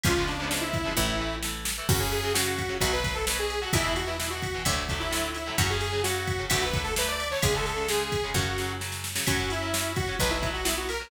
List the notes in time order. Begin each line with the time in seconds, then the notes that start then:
0.04 C#2 C#3 F3 G#3 B3 F4, kick, ride
0.16 C#3 F3 G#3 B3
0.27 D4, ride
0.38 C#3 F3 G#3 D4
0.43 B3
0.50 C#3 F3 G#3 B3 D4, snare
0.61 E4
0.74 kick, ride
0.84 C#3 F3 G#3 B3
0.97 A1 E3 A3 E4, kick
1.20 E3 A3
1.43 E3 A3, snare
1.65 snare
1.78 E3 A3
1.89 F#2 C#3 F#3 F#4, kick, crash
2.00 C#3 F#3 G#4
2.12 G#4, ride
2.23 C#3 F#3
2.34 C#3 F#3 F#4, snare
2.59 kick, ride
2.69 C#3 F#3
2.80 B1 B2 F#3 F#4, kick, ride
2.93 B4
3.04 B2 F#3, kick, ride
3.14 A4
3.27 B2 F#3 B4, snare
3.39 G#4
3.50 ride
3.61 B2 F#3 F#4
3.73 E2 B2 E3 E4, kick, ride
3.84 B2 E3
3.96 F#4, ride
4.07 B2 E3 E4
4.19 B2 E3 E4, snare
4.30 F#4
4.42 kick, ride
4.54 B2 E3
4.65 D2 A2 D3 F#3, kick, ride
4.89 A2 D3 F#3, kick, ride
5.00 E4
5.11 A2 D3 F#3, snare
5.34 E4, ride
5.46 A2 D3 F#3
5.58 F#2 C#3 F#3 F#4, kick, ride
5.70 C#3 F#3 G#4
5.81 G#4, ride
5.92 C#3 F#3
6.03 C#3 F#3 F#4, snare
6.27 kick, ride
6.39 C#3 F#3
6.50 D2 D3 F#3 A3 F#4, kick, ride
6.62 B4
6.74 D3 F#3 A3, kick, ride
6.84 A4
6.96 D3 F#3 A3 B4, snare
7.08 D5
7.20 ride
7.30 D3 F#3 A3 C#5
7.42 C#2 C#3 G#3 G#4, kick, ride
7.54 C#3 G#3 A4
7.66 A4, ride
7.77 C#3 G#3
7.88 C#3 G#3 G#4, snare
8.12 kick, ride
8.24 C#3 G#3
8.34 F#2 C#3 F#3 F#4, kick, snare
8.58 C#3 F#3, snare
8.80 C#3 F#3, snare
8.92 snare
9.04 snare
9.15 C#3 F#3, snare
9.27 F#2 F#3 C#4 F#4, kick, ride
9.39 F#3 C#4
9.50 E4, ride
9.61 F#3 C#4
9.73 F#3 C#4, snare
9.96 F#4, kick, ride
10.08 F#3 C#4
10.19 B1 F#3 B3 B4, kick, ride
10.30 E4
10.42 F#3 B3, kick, ride
10.53 F#4
10.65 F#3 B3 E4, snare
10.77 F#4
10.89 A#4, ride
11.00 F#3 B3